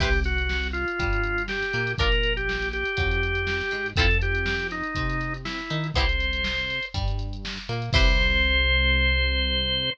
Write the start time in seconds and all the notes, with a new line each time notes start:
0.00 C2 E4 G4 B4 C5, kick, crash
0.13 closed hi-hat
0.24 F#4, snare, closed hi-hat
0.38 closed hi-hat
0.49 snare
0.63 snare, closed hi-hat
0.73 F4, closed hi-hat
0.88 closed hi-hat
0.99 G2 G3, kick, closed hi-hat
1.13 closed hi-hat
1.24 closed hi-hat
1.38 closed hi-hat
1.48 G4, snare
1.62 snare, closed hi-hat
1.73 A#2 A#3, snare, closed hi-hat
1.87 closed hi-hat
1.98 A#1 D4 F4 A#4, kick, closed hi-hat
2.11 snare, closed hi-hat
2.23 closed hi-hat
2.37 G4, closed hi-hat
2.49 snare
2.62 closed hi-hat
2.73 G4, closed hi-hat
2.85 closed hi-hat
2.97 F2 F#3, kick, closed hi-hat
3.11 closed hi-hat
3.23 closed hi-hat
3.35 closed hi-hat
3.47 snare
3.60 snare, closed hi-hat
3.71 G#2 G#3, closed hi-hat
3.86 closed hi-hat
3.96 F2 C4 E4 F4 A4, kick, closed hi-hat
4.09 snare, closed hi-hat
4.21 G4, closed hi-hat
4.35 closed hi-hat
4.46 snare
4.60 snare, closed hi-hat
4.71 D#4, snare, closed hi-hat
4.83 closed hi-hat
4.95 C3 C4, kick, closed hi-hat
5.09 snare, closed hi-hat
5.20 snare, closed hi-hat
5.34 closed hi-hat
5.45 E4, snare
5.58 snare, closed hi-hat
5.70 D#3 D#4, closed hi-hat
5.84 closed hi-hat
5.94 C2 B3 C4 E4 G4 C5, kick, closed hi-hat
6.09 closed hi-hat
6.20 closed hi-hat
6.33 closed hi-hat
6.44 snare
6.58 closed hi-hat
6.70 closed hi-hat
6.83 closed hi-hat
6.94 G2 G3, kick, closed hi-hat
7.08 closed hi-hat
7.19 closed hi-hat
7.33 closed hi-hat
7.45 snare
7.57 snare, closed hi-hat
7.69 A#2 A#3, closed hi-hat
7.82 closed hi-hat
7.93 C2 E4 G4 B4 C5, kick, crash